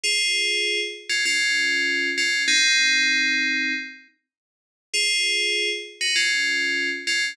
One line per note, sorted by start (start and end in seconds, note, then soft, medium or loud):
0.04 0.80 F4 medium
0.04 0.80 G#4 loud
1.09 1.24 C#4 medium
1.09 1.24 F4 medium
1.26 2.09 C#4 medium
1.26 2.09 F4 loud
2.18 2.43 C#4 medium
2.18 2.43 F4 medium
2.48 3.73 C4 loud
2.48 3.73 D#4 loud
4.93 5.69 F4 medium
4.93 5.69 G#4 loud
6.01 6.15 D#4 medium
6.01 6.15 F#4 medium
6.16 6.89 C#4 medium
6.16 6.89 F4 medium
7.07 7.32 C#4 medium
7.07 7.32 F4 medium